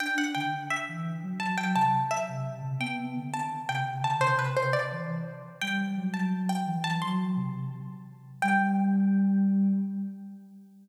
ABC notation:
X:1
M:4/4
L:1/8
Q:1/4=171
K:G
V:1 name="Pizzicato Strings"
g f g2 e4 | a g a2 e4 | g3 a2 g2 a | c B c d3 z2 |
g3 a2 g2 a | c'3 z5 | g8 |]
V:2 name="Ocarina"
D D D,2 z E,2 F, | F, F, C,2 z C,2 C, | B, B, D,2 z C,2 D, | C,4 E,2 z2 |
G,2 F,4 E,2 | F,2 C,3 z3 | G,8 |]